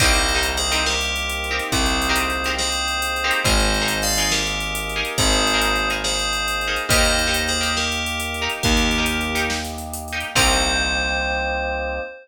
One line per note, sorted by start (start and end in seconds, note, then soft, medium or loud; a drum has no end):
0.00 1.60 C2 medium
0.00 3.41 A#3 medium
0.00 0.23 C4 medium
0.00 3.41 C4 medium
0.00 0.23 D#4 loud
0.00 3.41 D#4 medium
0.00 0.23 G4 medium
0.00 3.41 G4 medium
0.00 0.23 A#4 medium
0.00 0.46 C5 medium
0.00 0.46 D#5 medium
0.00 kick loud
0.00 closed hi-hat loud
0.13 closed hi-hat medium
0.29 closed hi-hat medium
0.35 0.58 C4 medium
0.35 0.58 D#4 medium
0.35 0.58 G4 medium
0.35 0.58 A#4 medium
0.43 closed hi-hat loud
0.57 0.82 G#4 medium
0.57 0.82 C5 medium
0.57 closed hi-hat medium
0.71 0.94 C4 medium
0.71 0.94 D#4 medium
0.71 0.94 G4 medium
0.71 0.94 A#4 medium
0.71 closed hi-hat medium
0.86 1.63 G4 medium
0.86 1.63 A#4 medium
0.86 snare loud
1.01 closed hi-hat medium
1.16 closed hi-hat medium
1.29 closed hi-hat loud
1.44 closed hi-hat medium
1.51 1.74 C4 medium
1.51 1.74 D#4 medium
1.51 1.74 G4 medium
1.51 1.74 A#4 medium
1.59 closed hi-hat medium
1.72 3.31 C2 medium
1.72 2.50 G#4 medium
1.72 2.50 C5 medium
1.72 kick loud
1.72 closed hi-hat loud
1.86 closed hi-hat medium
2.02 closed hi-hat loud
2.09 2.32 C4 medium
2.09 2.32 D#4 medium
2.09 2.32 G4 medium
2.09 2.32 A#4 medium
2.16 closed hi-hat loud
2.30 closed hi-hat medium
2.44 2.69 C4 medium
2.44 2.69 D#4 medium
2.44 2.69 G4 medium
2.44 2.69 A#4 medium
2.44 closed hi-hat medium
2.58 3.39 G#4 medium
2.58 3.39 C5 medium
2.58 snare loud
2.72 closed hi-hat medium
2.88 closed hi-hat medium
3.02 closed hi-hat loud
3.16 closed hi-hat medium
3.24 3.41 C4 medium
3.24 3.41 D#4 medium
3.24 3.41 G4 medium
3.24 3.41 A#4 medium
3.31 closed hi-hat loud
3.44 5.03 G#1 loud
3.44 6.87 A#3 medium
3.44 6.87 D#4 medium
3.44 3.68 D#4 medium
3.44 6.87 G#4 medium
3.44 3.68 G#4 medium
3.44 3.68 A#4 medium
3.44 3.99 C5 medium
3.44 3.99 D#5 medium
3.44 kick loud
3.44 closed hi-hat loud
3.60 closed hi-hat medium
3.74 closed hi-hat medium
3.81 4.04 D#4 medium
3.81 4.04 G#4 medium
3.81 4.04 A#4 medium
3.88 closed hi-hat loud
4.02 4.30 D5 medium
4.02 4.30 F5 medium
4.02 closed hi-hat medium
4.17 4.41 D#4 medium
4.17 4.41 G#4 medium
4.17 4.41 A#4 medium
4.17 closed hi-hat medium
4.31 5.13 G4 medium
4.31 5.13 A#4 medium
4.31 snare loud
4.47 closed hi-hat medium
4.60 closed hi-hat medium
4.75 closed hi-hat loud
4.89 closed hi-hat medium
4.96 5.19 D#4 medium
4.96 5.19 G#4 medium
4.96 5.19 A#4 medium
5.05 closed hi-hat medium
5.18 6.78 G#1 medium
5.18 5.88 G#4 medium
5.18 5.88 C5 medium
5.18 kick loud
5.18 closed hi-hat loud
5.33 closed hi-hat medium
5.47 closed hi-hat medium
5.54 5.77 D#4 medium
5.54 5.77 G#4 medium
5.54 5.77 A#4 medium
5.62 closed hi-hat loud
5.76 closed hi-hat medium
5.90 6.13 D#4 medium
5.90 6.13 G#4 medium
5.90 6.13 A#4 medium
5.90 closed hi-hat medium
6.04 6.77 G#4 medium
6.04 6.77 C5 medium
6.04 snare loud
6.19 closed hi-hat medium
6.33 closed hi-hat medium
6.48 closed hi-hat loud
6.61 closed hi-hat medium
6.68 6.85 D#4 medium
6.68 6.85 G#4 medium
6.68 6.85 A#4 medium
6.76 closed hi-hat medium
6.89 8.48 D#2 loud
6.89 10.33 A#3 medium
6.89 7.14 D#4 medium
6.89 10.33 D#4 medium
6.89 7.14 G4 medium
6.89 10.33 G4 medium
6.89 7.14 A#4 medium
6.89 7.41 C5 medium
6.89 7.41 D#5 medium
6.89 kick loud
6.89 closed hi-hat loud
7.05 closed hi-hat medium
7.19 closed hi-hat medium
7.27 7.50 D#4 medium
7.27 7.50 G4 medium
7.27 7.50 A#4 medium
7.34 closed hi-hat loud
7.48 7.74 G#4 medium
7.48 7.74 C5 medium
7.48 closed hi-hat medium
7.61 7.84 D#4 medium
7.61 7.84 G4 medium
7.61 7.84 A#4 medium
7.61 closed hi-hat medium
7.77 8.51 G4 medium
7.77 8.51 A#4 medium
7.77 snare loud
7.92 closed hi-hat medium
8.06 closed hi-hat loud
8.20 closed hi-hat loud
8.34 closed hi-hat medium
8.42 8.65 D#4 medium
8.42 8.65 G4 medium
8.42 8.65 A#4 medium
8.50 closed hi-hat medium
8.63 10.24 D#2 medium
8.63 9.45 G4 medium
8.63 9.45 A#4 medium
8.63 kick loud
8.63 closed hi-hat loud
8.77 closed hi-hat medium
8.91 closed hi-hat medium
8.98 9.21 D#4 medium
8.98 9.21 G4 medium
8.98 9.21 A#4 medium
9.06 closed hi-hat loud
9.21 closed hi-hat medium
9.35 9.58 D#4 medium
9.35 9.58 G4 medium
9.35 9.58 A#4 medium
9.35 closed hi-hat loud
9.50 snare loud
9.65 closed hi-hat medium
9.78 closed hi-hat medium
9.93 closed hi-hat loud
10.08 closed hi-hat medium
10.13 10.30 D#4 medium
10.13 10.30 G4 medium
10.13 10.30 A#4 medium
10.20 closed hi-hat medium
10.35 11.99 C2 loud
10.35 12.00 A#3 loud
10.35 12.00 C4 medium
10.35 12.00 C4 loud
10.35 12.00 D#4 loud
10.35 12.00 D#4 medium
10.35 12.00 G4 medium
10.35 12.00 G4 loud
10.35 12.00 A#4 loud
10.35 12.00 C5 loud
10.35 kick loud
10.35 crash loud